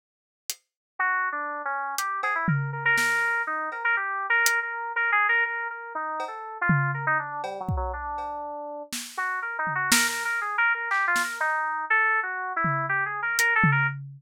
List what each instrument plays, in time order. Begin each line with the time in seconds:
0.50 closed hi-hat
0.99 electric piano 2 F#4
1.32 electric piano 2 D4
1.65 electric piano 2 C#4
1.98 electric piano 2 G4, closed hi-hat
2.23 electric piano 2 G#4, cowbell
2.35 electric piano 2 E4
2.48 electric piano 2 A#4, floor tom
2.73 electric piano 2 A#4
2.85 electric piano 2 A#4
2.98 electric piano 2 A#4, snare
3.47 electric piano 2 D#4
3.72 electric piano 2 A#4, cowbell
3.84 electric piano 2 A#4
3.97 electric piano 2 G4
4.30 electric piano 2 A#4
4.46 closed hi-hat
4.63 electric piano 2 A#4
4.96 electric piano 2 A#4
5.12 electric piano 2 G#4
5.29 electric piano 2 A#4
5.46 electric piano 2 A#4
5.70 electric piano 2 A#4
5.95 electric piano 2 D#4
6.20 cowbell
6.28 electric piano 2 A4
6.61 electric piano 2 F4
6.69 floor tom
6.94 electric piano 2 A#4
7.07 electric piano 2 D#4
7.19 electric piano 2 D4
7.44 electric piano 2 G3, cowbell
7.60 electric piano 2 F#3
7.69 kick
7.77 electric piano 2 F#3
7.93 electric piano 2 D4
8.18 cowbell
8.93 snare
9.17 electric piano 2 F#4
9.42 electric piano 2 A#4
9.59 electric piano 2 D#4
9.67 floor tom
9.75 electric piano 2 F#4
9.92 electric piano 2 A#4, snare
10.08 electric piano 2 A#4
10.25 electric piano 2 A#4
10.41 electric piano 2 G#4
10.58 electric piano 2 A#4
10.74 electric piano 2 A#4
10.91 electric piano 2 G4, clap
11.07 electric piano 2 F4
11.16 snare
11.24 electric piano 2 A#4
11.40 electric piano 2 D#4
11.90 electric piano 2 A4
12.23 electric piano 2 F#4
12.56 electric piano 2 E4
12.64 floor tom
12.89 electric piano 2 G4
13.06 electric piano 2 G#4
13.22 electric piano 2 A#4
13.39 electric piano 2 A#4, closed hi-hat
13.56 electric piano 2 A4
13.64 floor tom
13.72 electric piano 2 A#4